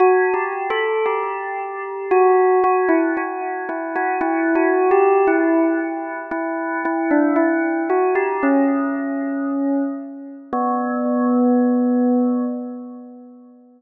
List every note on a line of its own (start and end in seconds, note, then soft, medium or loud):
0.00 0.33 F#4 medium
0.34 0.67 G4 medium
0.70 1.04 A4 medium
1.06 2.06 G4 medium
2.11 2.58 F#4 medium
2.64 2.89 F#4 medium
2.89 3.14 E4 medium
3.17 3.63 F#4 medium
3.69 3.94 E4 medium
3.96 4.21 F#4 medium
4.21 4.54 E4 medium
4.55 4.89 F#4 medium
4.91 5.24 G4 medium
5.27 6.21 E4 medium
6.31 6.77 E4 medium
6.85 7.10 E4 medium
7.11 7.36 D4 medium
7.36 7.82 E4 medium
7.90 8.15 F#4 medium
8.15 8.40 G4 medium
8.43 9.82 C#4 medium
10.53 12.45 B3 loud